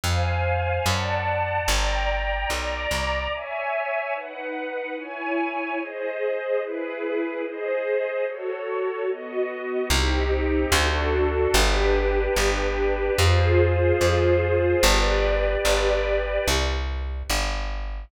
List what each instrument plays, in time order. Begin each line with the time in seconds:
0.04 electric bass (finger) F2, string ensemble 1 C5 F5 G#5
0.86 electric bass (finger) F#2, string ensemble 1 D5 F#5 A5
1.68 electric bass (finger) G1, string ensemble 1 D5 G5 A#5
2.50 electric bass (finger) B1, string ensemble 1 D5 A#5 D6
2.91 electric bass (finger) C2
3.32 string ensemble 1 C#5 E5 G#5
4.14 string ensemble 1 D#4 B4 F#5
4.97 string ensemble 1 E4 C#5 G#5
5.79 string ensemble 1 G#4 C5 D#5
6.61 string ensemble 1 E4 G#4 B4
7.43 string ensemble 1 G#4 C5 D#5
8.25 string ensemble 1 F#4 A4 C#5
9.08 string ensemble 1 B3 F#4 D#5
9.90 electric bass (finger) C2, string ensemble 1 C4 D#4 G4
10.72 electric bass (finger) D2, string ensemble 1 D4 F#4 A4
11.54 electric bass (finger) G1, string ensemble 1 D4 G4 B4
12.36 electric bass (finger) G1
13.18 electric bass (finger) F2, string ensemble 1 F4 G#4 C5
14.01 electric bass (finger) F2
14.83 electric bass (finger) G1, string ensemble 1 G4 B4 D5
15.65 electric bass (finger) G1
16.48 electric bass (finger) C2
17.30 electric bass (finger) G1